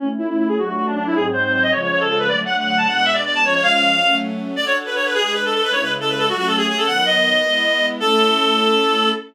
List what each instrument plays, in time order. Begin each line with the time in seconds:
0.00 string ensemble 1 A3 C#4 E4, clarinet C#4
0.18 clarinet E4
0.29 clarinet E4
0.38 clarinet E4
0.48 clarinet G#4
0.57 string ensemble 1 F#3 A3 D4, clarinet F#4
0.67 clarinet F#4
0.76 clarinet F#4
0.86 clarinet D4
0.96 clarinet D4
1.06 clarinet E4
1.14 string ensemble 1 G#2 F#3 C4 D#4, clarinet G#4
1.33 clarinet C5
1.43 clarinet C5
1.53 clarinet C5
1.62 clarinet D#5
1.71 string ensemble 1 C#3 F3 G#3, clarinet C#5
1.82 clarinet C#5
1.91 clarinet C#5
2.00 clarinet A4
2.09 clarinet A4
2.19 clarinet B4
2.28 string ensemble 1 D3 F#3 A3, clarinet D5
2.46 clarinet F#5
2.58 clarinet F#5
2.67 clarinet F#5
2.77 clarinet A5
2.86 string ensemble 1 B2 G#3 D4, clarinet F#5
2.96 clarinet F#5
3.05 clarinet E5
3.14 clarinet D5
3.26 clarinet D5
3.35 clarinet A5
3.43 string ensemble 1 F3 G#3 C#4, clarinet C#5
3.54 clarinet C#5
3.63 clarinet F5
3.72 clarinet F5
4.00 string ensemble 1 F#3 A3 C#4
4.56 string ensemble 1 D4 F#4 A4, clarinet D5
4.66 clarinet C#5
4.86 clarinet B4
4.96 clarinet C#5
5.05 clarinet B4
5.14 string ensemble 1 G#3 D4 B4, clarinet G#4
5.23 clarinet G#4
5.33 clarinet B4
5.45 clarinet A4
5.54 clarinet A4
5.63 clarinet B4
5.72 string ensemble 1 C#3 G#3 E4, clarinet C#5
5.82 clarinet B4
6.00 clarinet A4
6.09 clarinet B4
6.18 clarinet A4
6.29 string ensemble 1 F#3 A3 C#4, clarinet F#4
6.38 clarinet F#4
6.47 clarinet A4
6.57 clarinet G#4
6.68 clarinet G#4
6.77 clarinet A4
6.86 string ensemble 1 D#3 F#3 B3, clarinet F#5
7.05 clarinet D#5
7.43 string ensemble 1 G#3 B3 E4
8.00 string ensemble 1 A3 C#4 E4, clarinet A4